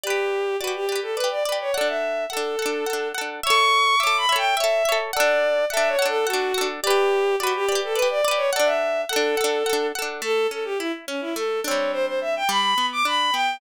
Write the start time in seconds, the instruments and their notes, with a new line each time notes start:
0.03 violin G4, acoustic guitar (steel) B4 D5
0.10 acoustic guitar (steel) G4
0.59 violin F#4, acoustic guitar (steel) D5
0.64 acoustic guitar (steel) G4 B4
0.75 violin G4
0.89 acoustic guitar (steel) B4 D5
0.96 acoustic guitar (steel) G4
1.02 violin A4
1.15 violin B4, acoustic guitar (steel) D5
1.20 acoustic guitar (steel) G4 B4
1.31 violin D5
1.44 violin D5, acoustic guitar (steel) D5
1.49 acoustic guitar (steel) G4 B4
1.61 violin C#5
1.74 acoustic guitar (steel) A4 F#5, violin D5
1.81 acoustic guitar (steel) D4
1.88 violin E5
2.30 violin A4, acoustic guitar (steel) A4 F#5
2.37 acoustic guitar (steel) D4
2.59 acoustic guitar (steel) A4 F#5
2.66 acoustic guitar (steel) D4
2.86 acoustic guitar (steel) A4 F#5
2.93 acoustic guitar (steel) D4
3.15 acoustic guitar (steel) A4 F#5
3.21 acoustic guitar (steel) D4
3.43 acoustic guitar (steel) C#5 E5, violin C#6
3.50 acoustic guitar (steel) A4
3.99 acoustic guitar (steel) E5, violin D6
4.03 acoustic guitar (steel) A4 C#5
4.17 violin B5
4.29 acoustic guitar (steel) C#5 E5
4.36 acoustic guitar (steel) A4, violin G5
4.57 acoustic guitar (steel) C#5 E5, violin E5
4.64 acoustic guitar (steel) A4
4.85 acoustic guitar (steel) C#5 E5
4.92 acoustic guitar (steel) A4
5.13 acoustic guitar (steel) A4 F#5, violin D5
5.20 acoustic guitar (steel) D4
5.70 acoustic guitar (steel) A4 F#5, violin E5
5.77 acoustic guitar (steel) D4
5.88 violin C#5
5.99 acoustic guitar (steel) A4 F#5
6.06 acoustic guitar (steel) D4, violin A4
6.27 violin F#4, acoustic guitar (steel) A4 F#5
6.33 acoustic guitar (steel) D4
6.54 acoustic guitar (steel) A4 F#5
6.61 acoustic guitar (steel) D4
6.83 violin G4, acoustic guitar (steel) D5
6.87 acoustic guitar (steel) G4 B4
7.40 violin F#4, acoustic guitar (steel) B4 D5
7.47 acoustic guitar (steel) G4
7.56 violin G4
7.69 acoustic guitar (steel) B4 D5
7.75 acoustic guitar (steel) G4
7.84 violin A4
7.94 violin B4, acoustic guitar (steel) D5
7.99 acoustic guitar (steel) G4 B4
8.10 violin D5
8.25 acoustic guitar (steel) B4 D5, violin D5
8.31 acoustic guitar (steel) G4
8.37 violin C#5
8.53 acoustic guitar (steel) A4 F#5, violin D5
8.59 acoustic guitar (steel) D4
8.65 violin E5
9.09 violin A4, acoustic guitar (steel) A4 F#5
9.16 acoustic guitar (steel) D4
9.37 acoustic guitar (steel) A4 F#5
9.44 acoustic guitar (steel) D4
9.66 acoustic guitar (steel) A4 F#5
9.73 acoustic guitar (steel) D4
9.95 acoustic guitar (steel) A4 F#5
10.02 acoustic guitar (steel) D4
10.22 acoustic guitar (steel) A3, violin A4
10.51 acoustic guitar (steel) C#4, violin A4
10.65 violin G4
10.78 violin E4, acoustic guitar (steel) E4
11.07 violin C#4, acoustic guitar (steel) C#4
11.21 violin E4
11.35 acoustic guitar (steel) A3, violin A4
11.64 acoustic guitar (steel) C4 D4, violin C#5
11.71 acoustic guitar (steel) G3
11.92 violin C5
12.06 violin C5
12.21 violin E5
12.36 violin G5
12.49 acoustic guitar (steel) G3, violin B5
12.78 acoustic guitar (steel) B3
12.92 violin D6
13.05 acoustic guitar (steel) D4, violin B5
13.33 acoustic guitar (steel) B3, violin G5